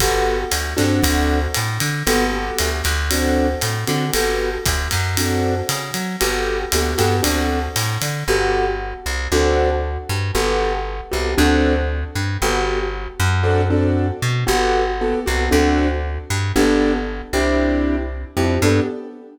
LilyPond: <<
  \new Staff \with { instrumentName = "Acoustic Grand Piano" } { \time 4/4 \key g \major \tempo 4 = 116 <b fis' g' a'>4. <c' d' fis' a'>2~ <c' d' fis' a'>8 | <b fis' g' a'>8 <b fis' g' a'>4. <c' d' fis' a'>4. <c' d' fis' a'>8 | <b fis' g' a'>2 <c' d' fis' a'>2 | <b fis' g' a'>4 <b fis' g' a'>8 <b fis' g' a'>8 <c' d' fis' a'>2 |
<b fis' g' a'>2 <c' d' fis' a'>2 | <b fis' g' a'>4. <b fis' g' a'>8 <c' d' fis' a'>2 | <b fis' g' a'>2 <c' d' fis' a'>8 <c' d' fis' a'>4. | <b fis' g' a'>4 <b fis' g' a'>8 <b fis' g' a'>8 <c' d' fis' a'>2 |
<b d' g' a'>4. <c' d' e' g'>2 <c' d' e' g'>8 | <b d' g' a'>4 r2. | }
  \new Staff \with { instrumentName = "Electric Bass (finger)" } { \clef bass \time 4/4 \key g \major g,,4 d,8 g,8 d,4 a,8 d8 | g,,4 d,8 d,4. a,8 d8 | g,,4 d,8 fis,4. cis8 fis8 | g,,4 d,8 g,8 d,4 a,8 d8 |
g,,4. c,8 d,4. g,8 | g,,4. c,8 d,4. g,8 | g,,4. fis,2 b,8 | g,,4. c,8 d,4. g,8 |
g,,4. c,2 f,8 | g,4 r2. | }
  \new DrumStaff \with { instrumentName = "Drums" } \drummode { \time 4/4 <bd cymr>4 <hhp cymr>8 <cymr sn>8 <bd cymr>4 <hhp cymr>8 cymr8 | cymr4 <hhp cymr>8 <cymr sn>8 cymr4 <hhp cymr>8 cymr8 | cymr4 <hhp bd cymr>8 <cymr sn>8 cymr4 <hhp cymr>8 cymr8 | cymr4 <hhp cymr>8 <cymr sn>8 cymr4 <hhp cymr>8 cymr8 |
r4 r4 r4 r4 | r4 r4 r4 r4 | r4 r4 r4 r4 | r4 r4 r4 r4 |
r4 r4 r4 r4 | r4 r4 r4 r4 | }
>>